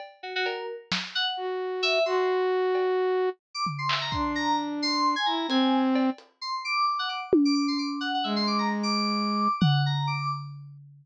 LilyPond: <<
  \new Staff \with { instrumentName = "Flute" } { \time 9/8 \tempo 4. = 87 r2. fis'4. | fis'2. r4. | d'2~ d'8 e'8 c'4. | r1 r8 |
gis2. r4. | }
  \new Staff \with { instrumentName = "Electric Piano 2" } { \time 9/8 r8 fis'16 fis'16 ais'8 r4 fis''16 r4 r16 e''8 | c'''8 r2 r8. d'''16 r16 c'''16 e''16 ais''16 | c'''8 ais''8 r8 c'''8. gis''16 ais''8 gis''8. r8. | r8 c'''8 d'''8 d'''16 fis''16 d'''16 r8 d'''16 d'''16 c'''16 d'''16 r16 fis''16 fis''16 |
e''16 c'''16 d'''16 ais''16 r16 d'''4.~ d'''16 fis''8 ais''8 d'''8 | }
  \new DrumStaff \with { instrumentName = "Drums" } \drummode { \time 9/8 cb4 cb8 r8 sn4 r4. | r4. cb4. r8 tomfh8 hc8 | bd4. r4. hh4 cb8 | hh4. r4 tommh8 r4. |
r4. r4. tomfh4. | }
>>